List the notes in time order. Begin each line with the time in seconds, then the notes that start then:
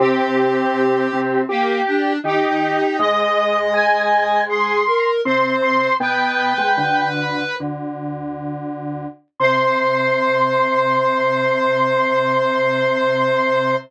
0.00 C3 C4 G4
1.13 C3 C4
1.49 A#3 G4
1.87 D4
2.24 D#3 D#4 G4
2.99 G#2 G#3 D#5
3.74 G#5
4.49 G#4 C6
4.86 A#4
5.25 C3 C4 C5 C6
5.62 C6
6.00 B2 B3 B4 G5
6.58 G#2 G#3
6.77 D2 D3
7.60 D2 D3
9.40 C3 C5 C6